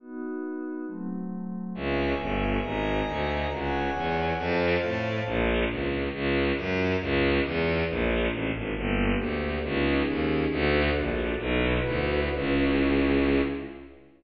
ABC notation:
X:1
M:2/2
L:1/8
Q:1/2=137
K:Bm
V:1 name="Pad 5 (bowed)"
[B,^DF]8 | [F,A,=C]8 | [ce^g]8 | [^d^g^a]8 |
[cf^g]8 | [=c=fa]8 | [K:D] z8 | z8 |
z8 | z8 | [K:Bm] [_B,DG]8 | [C^D^G]8 |
[DFA]8 | "^rit." [EFB]8 | [CE^G]8 |]
V:2 name="Violin" clef=bass
z8 | z8 | C,,4 G,,,4 | ^G,,,4 D,,4 |
C,,4 E,,4 | =F,,4 A,,4 | [K:D] _B,,,4 _D,,4 | C,,4 F,,4 |
C,,4 E,,4 | _B,,,4 A,,,2 ^G,,,2 | [K:Bm] G,,,4 D,,4 | C,,4 ^D,,4 |
D,,4 _B,,,4 | "^rit." B,,,4 D,,4 | C,,8 |]